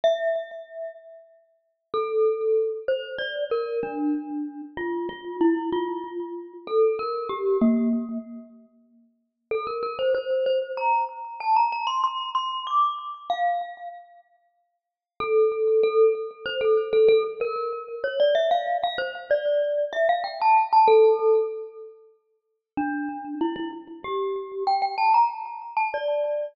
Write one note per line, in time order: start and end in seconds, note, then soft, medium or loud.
0.04 0.95 E5 medium
1.94 2.74 A4 medium
2.88 3.17 C5 medium
3.18 3.44 D5 medium
3.51 3.80 A#4 medium
3.83 4.62 D4 medium
4.77 5.06 F4 medium
5.09 5.36 F4 medium
5.41 5.69 E4 medium
5.72 6.53 F4 medium
6.67 6.95 A4 medium
6.99 7.30 A#4 medium
7.29 7.58 G4 medium
7.61 8.18 A#3 medium
9.51 9.66 A4 medium
9.67 9.82 A#4 medium
9.83 9.98 A#4 medium
9.99 10.14 C5 medium
10.14 10.45 C5 medium
10.46 10.72 C5 medium
10.77 11.04 A#5 medium
11.40 11.55 A5 medium
11.56 11.71 A#5 medium
11.72 11.87 A#5 medium
11.87 12.02 C6 medium
12.04 12.29 C6 medium
12.35 12.62 C6 medium
12.67 12.94 D6 medium
13.30 13.89 F5 medium
15.20 15.81 A4 medium
15.83 16.13 A4 medium
16.46 16.61 C5 medium
16.61 16.88 A4 medium
16.93 17.08 A4 medium
17.08 17.23 A4 loud
17.41 17.95 A#4 medium
18.04 18.19 C#5 medium
18.20 18.35 D5 medium
18.35 18.50 E5 medium
18.51 18.77 F5 medium
18.83 18.98 F5 medium
18.98 19.13 C5 medium
19.31 19.85 D5 medium
19.93 20.08 E5 medium
20.09 20.24 F5 medium
20.24 20.39 G5 medium
20.41 20.67 A5 medium
20.73 20.88 A5 medium
20.88 21.46 A4 loud
22.77 23.35 D4 medium
23.41 23.55 E4 medium
23.56 23.71 E4 medium
24.04 24.63 G4 medium
24.67 24.81 G5 medium
24.82 24.97 G5 medium
24.98 25.13 A5 medium
25.14 25.29 A#5 medium
25.76 25.91 A5 medium
25.94 26.53 D5 medium